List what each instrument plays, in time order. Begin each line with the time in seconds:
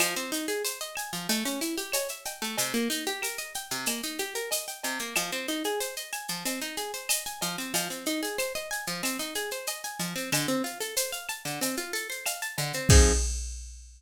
0.00 acoustic guitar (steel) F3, cowbell, claves, shaker
0.16 acoustic guitar (steel) C4, shaker
0.32 acoustic guitar (steel) D#4, shaker
0.48 acoustic guitar (steel) G#4, shaker
0.65 acoustic guitar (steel) C5, shaker
0.81 acoustic guitar (steel) D#5, shaker
0.96 acoustic guitar (steel) G#5, claves, shaker
1.13 acoustic guitar (steel) F3, shaker
1.29 acoustic guitar (steel) A3, cowbell, shaker
1.45 acoustic guitar (steel) C#4, shaker
1.61 acoustic guitar (steel) E4, shaker
1.78 acoustic guitar (steel) G4, shaker
1.92 acoustic guitar (steel) C#5, cowbell, claves, shaker
2.08 acoustic guitar (steel) E5, shaker
2.25 acoustic guitar (steel) G5, cowbell, shaker
2.42 acoustic guitar (steel) A3, shaker
2.58 acoustic guitar (steel) C3, cowbell, shaker
2.74 acoustic guitar (steel) A#3, shaker
2.90 acoustic guitar (steel) D#4, shaker
3.06 acoustic guitar (steel) G4, shaker
3.22 acoustic guitar (steel) A#4, claves, shaker
3.38 acoustic guitar (steel) D#5, shaker
3.54 acoustic guitar (steel) G5, shaker
3.71 acoustic guitar (steel) C3, shaker
3.86 acoustic guitar (steel) A#3, cowbell, claves, shaker
4.03 acoustic guitar (steel) D#4, shaker
4.19 acoustic guitar (steel) G4, shaker
4.35 acoustic guitar (steel) A#4, shaker
4.51 acoustic guitar (steel) D#5, cowbell, shaker
4.68 acoustic guitar (steel) G5, shaker
4.83 acoustic guitar (steel) C3, cowbell, shaker
4.99 acoustic guitar (steel) A#3, shaker
5.15 acoustic guitar (steel) F3, cowbell, claves, shaker
5.32 acoustic guitar (steel) C4, shaker
5.48 acoustic guitar (steel) D#4, shaker
5.64 acoustic guitar (steel) G#4, shaker
5.80 acoustic guitar (steel) C5, shaker
5.97 acoustic guitar (steel) D#5, shaker
6.13 acoustic guitar (steel) G#5, claves, shaker
6.28 acoustic guitar (steel) F3, shaker
6.45 acoustic guitar (steel) C4, cowbell, shaker
6.61 acoustic guitar (steel) D#4, shaker
6.77 acoustic guitar (steel) G#4, shaker
6.94 acoustic guitar (steel) C5, shaker
7.09 acoustic guitar (steel) D#5, cowbell, claves, shaker
7.26 acoustic guitar (steel) G#5, shaker
7.41 acoustic guitar (steel) F3, cowbell, shaker
7.58 acoustic guitar (steel) C4, shaker
7.74 acoustic guitar (steel) F3, cowbell, shaker
7.90 acoustic guitar (steel) C4, shaker
8.06 acoustic guitar (steel) D#4, shaker
8.23 acoustic guitar (steel) G#4, shaker
8.38 acoustic guitar (steel) C5, claves, shaker
8.55 acoustic guitar (steel) D#5, shaker
8.71 acoustic guitar (steel) G#5, shaker
8.87 acoustic guitar (steel) F3, shaker
9.03 acoustic guitar (steel) C4, cowbell, claves, shaker
9.19 acoustic guitar (steel) D#4, shaker
9.35 acoustic guitar (steel) G#4, shaker
9.51 acoustic guitar (steel) C5, shaker
9.67 acoustic guitar (steel) D#5, cowbell, shaker
9.84 acoustic guitar (steel) G#5, shaker
9.99 acoustic guitar (steel) F3, cowbell, shaker
10.16 acoustic guitar (steel) C4, shaker
10.32 acoustic guitar (steel) D3, cowbell, claves, shaker
10.48 acoustic guitar (steel) C4, shaker
10.64 acoustic guitar (steel) F4, shaker
10.81 acoustic guitar (steel) A4, shaker
10.97 acoustic guitar (steel) C5, shaker
11.12 acoustic guitar (steel) F5, shaker
11.29 acoustic guitar (steel) A5, claves, shaker
11.45 acoustic guitar (steel) D3, shaker
11.61 acoustic guitar (steel) C4, cowbell, shaker
11.77 acoustic guitar (steel) F4, shaker
11.93 acoustic guitar (steel) A4, shaker
12.10 acoustic guitar (steel) C5, shaker
12.26 acoustic guitar (steel) F5, cowbell, claves, shaker
12.42 acoustic guitar (steel) A5, shaker
12.58 acoustic guitar (steel) D3, cowbell, shaker
12.73 acoustic guitar (steel) C4, shaker
12.89 acoustic guitar (steel) F3 C4 D#4 G#4, kick, crash